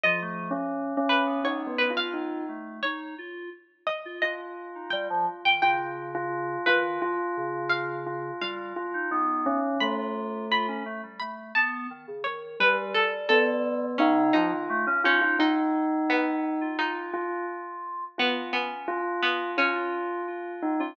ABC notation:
X:1
M:2/4
L:1/16
Q:1/4=86
K:none
V:1 name="Tubular Bells"
(3F,4 ^C4 C4 | (3^D2 B,2 F2 D2 z2 | z8 | F8 |
F3 F3 F2 | F6 F2 | F2 F2 ^D2 ^C2 | A,6 z2 |
z8 | G,2 z2 B,4 | ^D2 F3 ^C F F | ^D8 |
F2 F2 z4 | F2 z2 F4 | F6 ^D ^C |]
V:2 name="Pizzicato Strings"
^d6 B2 | ^c2 B f5 | ^c2 z4 ^d2 | ^d4 g3 g |
g6 B2 | z4 f4 | f8 | b4 b4 |
b2 a4 ^c2 | B2 A2 A4 | ^C2 ^D4 C2 | ^D4 B,4 |
^D4 z4 | B,2 B,4 B,2 | ^C8 |]
V:3 name="Electric Piano 2"
F A,2 z4 B, | B,3 F3 A,2 | ^D2 F2 z3 F | z3 ^D G, F, z ^D, |
^C,6 ^D,2 | z2 ^C,6 | G,2 z ^D B,3 z | F F3 F ^C A, G, |
A,2 B,2 ^D, ^C, D,2 | G,8 | ^C,2 F, ^D, A, ^C ^D2 | z7 F |
F8 | z2 ^C3 z3 | z F3 F3 F |]